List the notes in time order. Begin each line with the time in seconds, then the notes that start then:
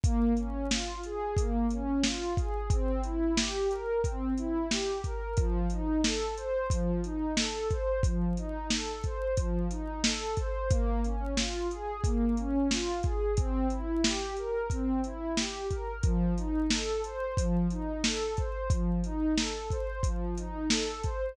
0.04 A#3, kick, closed hi-hat
0.37 C#4, closed hi-hat
0.71 F4, snare
1.03 G#4, closed hi-hat
1.37 A#3, kick, closed hi-hat
1.71 C#4, closed hi-hat
2.04 F4, snare
2.37 G#4, kick, closed hi-hat
2.70 C4, kick, closed hi-hat
3.04 E4, closed hi-hat
3.37 G4, snare
3.70 A#4, closed hi-hat
4.03 C4, kick, closed hi-hat
4.38 E4, closed hi-hat
4.71 G4, snare
5.04 A#4, kick, closed hi-hat
5.37 F3, kick, closed hi-hat
5.70 D#4, closed hi-hat
6.04 A4, snare
6.37 C5, closed hi-hat
6.70 F3, kick, closed hi-hat
7.04 D#4, closed hi-hat
7.37 A4, snare
7.71 C5, kick, closed hi-hat
8.03 F3, kick, closed hi-hat
8.37 D#4, closed hi-hat
8.70 A4, snare
9.04 C5, kick, closed hi-hat
9.37 F3, kick, closed hi-hat
9.71 D#4, closed hi-hat
10.04 A4, snare
10.37 C5, kick, closed hi-hat
10.70 A#3, kick, closed hi-hat
11.04 C#4, closed hi-hat
11.37 F4, snare
11.71 G#4, closed hi-hat
12.04 A#3, kick, closed hi-hat
12.37 C#4, closed hi-hat
12.71 F4, snare
13.03 G#4, kick, closed hi-hat
13.37 C4, kick, closed hi-hat
13.70 E4, closed hi-hat
14.04 G4, snare
14.37 A#4, closed hi-hat
14.70 C4, kick, closed hi-hat
15.04 E4, closed hi-hat
15.37 G4, snare
15.70 A#4, kick, closed hi-hat
16.03 F3, kick, closed hi-hat
16.37 D#4, closed hi-hat
16.70 A4, snare
17.04 C5, closed hi-hat
17.37 F3, kick, closed hi-hat
17.71 D#4, closed hi-hat
18.04 A4, snare
18.37 C5, kick, closed hi-hat
18.70 F3, kick, closed hi-hat
19.04 D#4, closed hi-hat
19.38 A4, snare
19.71 C5, kick, closed hi-hat
20.03 F3, kick, closed hi-hat
20.38 D#4, closed hi-hat
20.70 A4, snare
21.04 C5, kick, closed hi-hat